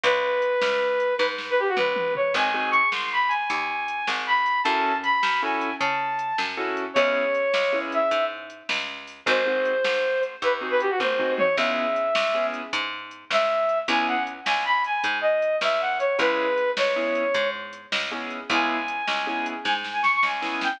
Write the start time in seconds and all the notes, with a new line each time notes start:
0.04 C#2 B4, kick, closed hi-hat
0.42 closed hi-hat
0.62 C#2, snare
1.00 closed hi-hat
1.17 G#2 B4, kick, snare
1.38 snare
1.50 B4
1.59 G4
1.68 F#4
1.77 C#2 B4, mid tom
1.96 mid tom
2.15 C#5, floor tom
2.34 G#1 C4 D#4 F#4 G#4 G#5, kick, crash
2.54 C4 D#4 F#4 G#4
2.71 C#6, closed hi-hat
2.92 G#1 C6, snare
3.12 B5
3.28 G#5, closed hi-hat
3.50 D#2, kick, closed hi-hat
3.88 closed hi-hat
4.07 G#1, snare
4.27 B5
4.46 closed hi-hat
4.64 F#2 C#4 E4 F#4 A4 A5, kick, closed hi-hat
5.03 B5, closed hi-hat
5.23 F#2, snare
5.42 C#4 E4 F#4 A4 G#5
5.61 closed hi-hat
5.80 C#3 A5, kick, closed hi-hat
6.19 closed hi-hat
6.38 F#2, snare
6.57 C#4 E4 F#4 A4
6.77 closed hi-hat
6.94 C#2 B3 C#4 E4 G#4 C#5, kick, closed hi-hat
7.35 closed hi-hat
7.54 C#2, snare
7.73 B3 C#4 E4 G#4
7.92 E5, closed hi-hat
8.11 G#2, kick, closed hi-hat
8.50 closed hi-hat
8.69 C#2, snare
9.07 open hi-hat
9.26 G#1 C4 D#4 F#4 G#4 C5, kick, closed hi-hat
9.46 C4 D#4 F#4 G#4
9.65 closed hi-hat
9.84 G#1, snare
10.23 closed hi-hat
10.42 D#2 B4, kick, closed hi-hat
10.61 C4 D#4 F#4 G#4
10.71 B4
10.80 G4, closed hi-hat
10.90 F#4
10.99 G#1 C5, kick, high tom
11.19 C4 D#4 F#4 G#4, floor tom
11.38 C#5, mid tom
11.56 C#2 B3 C#4 E4 G#4 E5, kick, crash
11.96 closed hi-hat
12.15 C#2, snare
12.34 B3 C#4 E4 G#4
12.54 closed hi-hat
12.73 G#2, kick, closed hi-hat
13.11 closed hi-hat
13.30 C#2 E5, snare
13.69 closed hi-hat
13.88 C#2 B3 C#4 E4 G#4 G#5, kick, closed hi-hat
14.07 F#5
14.27 closed hi-hat
14.45 C#2 G#5, snare
14.65 B5
14.84 G#5, closed hi-hat
15.04 G#2, kick, closed hi-hat
15.21 D#5
15.42 closed hi-hat
15.61 C#2 E5, snare
15.81 F#5
15.99 C#5, closed hi-hat
16.19 C#2 B3 C#4 E4 G#4 B4, kick, closed hi-hat
16.58 closed hi-hat
16.77 C#2 C#5, snare
16.96 B3 C#4 E4 G#4
17.15 closed hi-hat
17.34 G#2, kick, closed hi-hat
17.73 closed hi-hat
17.92 C#2, snare
18.12 B3 C#4 E4 G#4
18.30 closed hi-hat
18.50 C#2 B3 C#4 E4 G#4 G#5, kick, closed hi-hat
18.88 closed hi-hat
19.07 C#2, snare
19.27 B3 C#4 E4 G#4
19.46 closed hi-hat
19.64 G#2 G#5, kick, snare
19.84 snare
19.93 G#5
20.03 C#6, snare
20.16 C#6
20.23 C#2 G#5, snare
20.42 B3 C#4 E4 G#4, snare
20.61 G5, snare